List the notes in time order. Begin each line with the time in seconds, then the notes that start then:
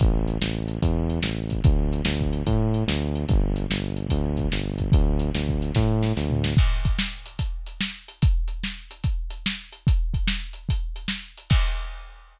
0.00 A1, kick, closed hi-hat
0.28 closed hi-hat
0.41 A1, snare
0.68 closed hi-hat
0.82 E2, kick, closed hi-hat
1.10 closed hi-hat
1.23 A1, snare
1.50 kick, closed hi-hat
1.64 D2, kick, closed hi-hat
1.93 closed hi-hat
2.05 D2, snare
2.21 kick
2.33 closed hi-hat
2.47 A2, kick, closed hi-hat
2.74 closed hi-hat
2.88 D2, snare
3.15 closed hi-hat
3.29 G1, kick, closed hi-hat
3.56 closed hi-hat
3.70 G1, snare
3.97 closed hi-hat
4.09 D2, kick, closed hi-hat
4.37 kick, closed hi-hat
4.52 G1, snare
4.78 kick, closed hi-hat
4.92 D2, kick, closed hi-hat
5.19 closed hi-hat
5.34 D2, snare
5.49 kick
5.62 closed hi-hat
5.75 A2, kick, snare
6.03 snare
6.16 D2, snare
6.30 floor tom
6.44 snare
6.57 kick, crash
6.85 kick, closed hi-hat
6.99 snare
7.26 closed hi-hat
7.39 kick, closed hi-hat
7.66 closed hi-hat
7.81 snare
8.08 closed hi-hat
8.22 kick, closed hi-hat
8.48 closed hi-hat
8.64 snare
8.91 closed hi-hat
9.04 kick, closed hi-hat
9.30 closed hi-hat
9.46 snare
9.72 closed hi-hat
9.87 kick, closed hi-hat
10.14 kick, closed hi-hat
10.27 snare
10.53 closed hi-hat
10.69 kick, closed hi-hat
10.96 closed hi-hat
11.08 snare
11.38 closed hi-hat
11.50 kick, crash